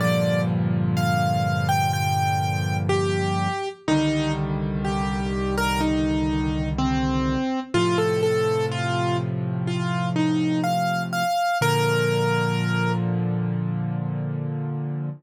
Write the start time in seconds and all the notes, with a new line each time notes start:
0.00 G2 A#2 D3 F3 D5
0.97 F5
1.69 G5
1.93 G5
2.89 G4
3.88 C2 D3 D#3 G3 D#4
4.84 G4
5.57 A#4
5.81 D#4
6.78 C4
7.74 A2 C3 F3 F4
7.98 A4
8.23 A4
8.71 F4
9.67 F4
10.16 D#4
10.64 F5
11.13 F5
11.61 A#2 D3 F3 A#4